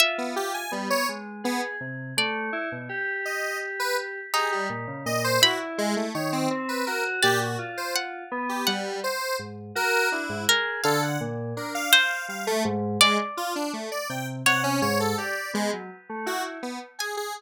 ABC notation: X:1
M:6/8
L:1/16
Q:3/8=55
K:none
V:1 name="Orchestral Harp"
e12 | d8 z4 | ^D6 b6 | z4 d4 ^f4 |
^f10 ^A2 | f2 z4 c6 | d8 ^c4 | z10 ^g2 |]
V:2 name="Lead 1 (square)"
z B, G ^g =G, ^c z2 B, z3 | z6 ^d2 z B z2 | ^G =G, z2 ^d c ^F z ^G, A, ^c =C | z B ^A z G ^F z c z3 G |
G,2 c2 z2 ^A2 E2 z2 | A ^f z2 ^A =f f2 f =A, z2 | ^G, z F D A, d =g z ^f ^C ^c A | d2 ^G, z3 ^F z B, z ^G G |]
V:3 name="Electric Piano 2"
F4 B,2 ^G,2 ^G2 C,2 | A,2 E B,, G8 | G2 ^A,, ^C, A,,2 E4 ^D,2 | C2 ^F2 ^A,,2 =F4 B,2 |
z4 ^G,,2 ^F2 D G,, ^G2 | D,2 ^A,,2 D2 z2 G, z ^G,,2 | z6 C,2 C,2 ^G,,2 | G z B, ^F, z A, E2 z4 |]